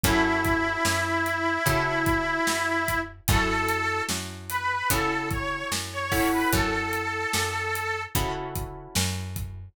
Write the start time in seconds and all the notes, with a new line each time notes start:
0.03 F#2 C#4 E4 F#4 A4, kick, closed hi-hat
0.44 kick, closed hi-hat
0.85 F#2, snare
1.26 closed hi-hat
1.66 C#3 C#4 E4 F#4 A4, kick, closed hi-hat
2.06 kick, closed hi-hat
2.47 F#2, snare
2.88 kick, closed hi-hat
3.28 F#2 C#4 E4 F#4 A4, kick, closed hi-hat
3.68 closed hi-hat
4.09 F#2, snare
4.49 B4, closed hi-hat
4.90 C#3 C#4 E4 F#4 A4, kick, closed hi-hat
5.31 C#5, kick, closed hi-hat
5.72 F#2, snare
5.93 C#5
6.12 C#4 E4 F#4 A4, kick, open hi-hat
6.32 B4
6.53 F#2 A4, kick, closed hi-hat
6.93 closed hi-hat
7.33 F#2, snare
7.75 closed hi-hat
8.15 C#3 C#4 E4 F#4 A4, kick, closed hi-hat
8.55 kick, closed hi-hat
8.95 F#2, snare
9.36 kick, closed hi-hat